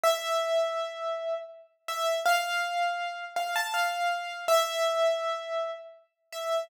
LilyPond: \new Staff { \time 3/4 \key a \minor \tempo 4 = 81 e''2 r8 e''8 | f''4. f''16 a''16 f''4 | e''2 r8 e''8 | }